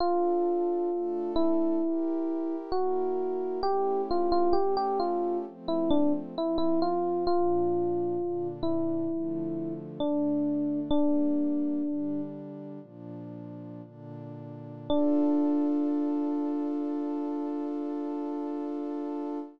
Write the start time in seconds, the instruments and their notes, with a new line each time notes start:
0.00 pad 2 (warm) D4 F4 A4, electric piano 1 F4
0.90 pad 2 (warm) A3 D4 A4
1.36 electric piano 1 E4
1.82 pad 2 (warm) E4 G4 A#4
2.72 pad 2 (warm) A#3 E4 A#4, electric piano 1 F#4
3.63 pad 2 (warm) A3 C#4 E4 G4, electric piano 1 G4
4.11 electric piano 1 F4
4.32 electric piano 1 F4
4.53 pad 2 (warm) A3 C#4 G4 A4, electric piano 1 G4
4.77 electric piano 1 G4
5.00 electric piano 1 F4
5.45 pad 2 (warm) F3 A3 C4
5.68 electric piano 1 E4
5.91 electric piano 1 D4
6.36 pad 2 (warm) F3 C4 F4, electric piano 1 E4
6.58 electric piano 1 E4
6.82 electric piano 1 F4
7.27 pad 2 (warm) A#2 F3 D4, electric piano 1 F4
8.18 pad 2 (warm) A#2 D3 D4
8.63 electric piano 1 E4
9.10 pad 2 (warm) D3 F3 A3
9.99 pad 2 (warm) D3 A3 D4, electric piano 1 D4
10.90 pad 2 (warm) G3 A#3 D4, electric piano 1 D4
11.83 pad 2 (warm) D3 G3 D4
12.81 pad 2 (warm) A#2 F3 D4
13.83 pad 2 (warm) A#2 D3 D4
14.88 pad 2 (warm) D4 F4 A4, electric piano 1 D4